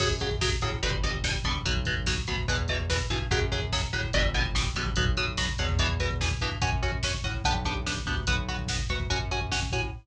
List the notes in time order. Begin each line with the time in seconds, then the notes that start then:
0.00 F#2 C#3 F#3, kick, crash
0.10 kick
0.20 C#3 F#3, kick, closed hi-hat
0.31 kick
0.41 C#3 F#3, kick, snare
0.52 kick
0.61 A2 C#3 F#3, kick, closed hi-hat
0.72 kick
0.83 G1 B2 D3 G3, kick, closed hi-hat
0.92 kick
1.03 B2 D3 G3, kick, closed hi-hat
1.14 kick
1.24 B2 D3 G3, kick, snare
1.35 kick
1.44 A#1 B2 D3 G3, kick, closed hi-hat
1.55 kick
1.65 B1 B2 F#3, kick, closed hi-hat
1.76 kick
1.85 B2 F#3, kick, closed hi-hat
1.97 kick
2.06 B2 F#3, kick, snare
2.17 kick
2.27 D2 B2 F#3, kick, closed hi-hat
2.38 kick
2.48 E2 B2 E3, kick, closed hi-hat
2.58 kick
2.68 B2 E3, kick, closed hi-hat
2.80 kick
2.90 B2 E3, kick, snare
2.99 kick
3.10 G2 B2 E3, kick, closed hi-hat
3.20 kick
3.31 F#2 C#3 F#3, kick, closed hi-hat
3.42 kick
3.52 C#3 F#3, kick, closed hi-hat
3.62 kick
3.72 C#3 F#3, kick, snare
3.82 kick
3.93 A2 C#3 F#3, kick, closed hi-hat
4.03 kick
4.13 G1 B2 D3 G3, kick, closed hi-hat
4.25 kick
4.34 B2 D3 G3, kick, closed hi-hat
4.45 kick
4.55 B2 D3 G3, kick, snare
4.66 kick
4.75 A#1 B2 D3 G3, kick, closed hi-hat
4.86 kick
4.96 B1 B2 F#3, kick, closed hi-hat
5.06 kick
5.17 B2 F#3, kick, closed hi-hat
5.28 kick
5.37 B2 F#3, kick, snare
5.49 kick
5.58 E2 B2 F#3, kick, closed hi-hat
5.69 kick
5.79 B2 E3, kick, closed hi-hat
5.89 kick
6.00 B2 E3, kick, closed hi-hat
6.11 kick
6.21 B2 E3, kick, snare
6.31 kick
6.41 G2 B2 E3, kick, closed hi-hat
6.52 kick
6.62 F#2 C#4 F#4, kick, closed hi-hat
6.72 kick
6.83 C#4 F#4, kick, closed hi-hat
6.92 kick
7.03 C#4 F#4, kick, snare
7.14 kick
7.24 A2 C#4 F#4, kick, closed hi-hat
7.34 kick
7.44 B1 B3 D4 G4, kick, closed hi-hat
7.55 kick
7.65 B3 D4 G4, kick, closed hi-hat
7.77 kick
7.86 B3 D4 G4, kick, snare
7.97 kick
8.06 D2 B3 D4 G4, kick, closed hi-hat
8.17 kick
8.27 B1 B3 F#4, kick, closed hi-hat
8.38 kick
8.49 B3 F#4, kick, closed hi-hat
8.59 kick
8.68 B3 F#4, kick, snare
8.79 kick
8.89 D2 B3 F#4, kick, closed hi-hat
9.00 kick
9.10 F#2 C#4 F#4, kick, closed hi-hat
9.21 kick
9.31 C#4 F#4, kick, closed hi-hat
9.41 kick
9.52 C#4 F#4, kick, snare
9.62 kick
9.72 A2 C#4 F#4, kick, closed hi-hat
9.82 kick